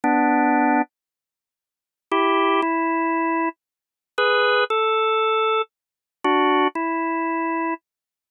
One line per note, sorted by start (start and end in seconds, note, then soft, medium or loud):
0.04 0.82 B3 medium
0.04 0.82 D4 medium
2.11 2.61 E4 medium
2.11 2.61 G4 medium
2.62 3.49 E4 medium
4.18 4.64 G#4 medium
4.18 4.64 B4 medium
4.70 5.62 A4 loud
6.24 6.68 D4 medium
6.24 6.68 F#4 medium
6.75 7.74 E4 medium